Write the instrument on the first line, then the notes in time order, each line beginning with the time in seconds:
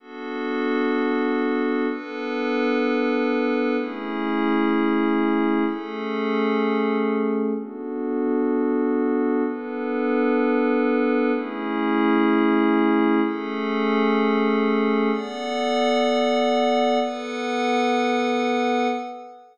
pad 5 (bowed)
0.00 B3 D4 F#4 A4
1.90 B3 D4 A4 B4
3.77 A3 C#4 E4 G#4
5.66 A3 C#4 G#4 A4
7.56 B3 D4 F#4 A4
9.45 B3 D4 A4 B4
11.34 A3 C#4 E4 G#4
13.24 A3 C#4 G#4 A4
15.12 B3 A4 D5 F#5
17.01 B3 A4 B4 F#5